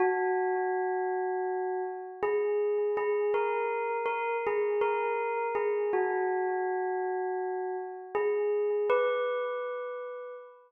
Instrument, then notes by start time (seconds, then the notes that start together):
tubular bells
0.00 F#4
2.23 G#4
2.97 G#4
3.34 A#4
4.06 A#4
4.47 G#4
4.81 A#4
5.55 G#4
5.93 F#4
8.15 G#4
8.90 B4